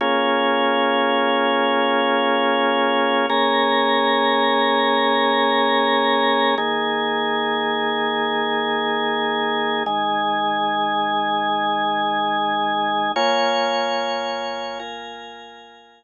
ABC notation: X:1
M:4/4
L:1/8
Q:1/4=73
K:Bbm
V:1 name="Drawbar Organ"
[B,DFA]8 | [B,DAB]8 | [E,B,A]8 | [E,A,A]8 |
[B,Fda]4 [B,FBa]4 |]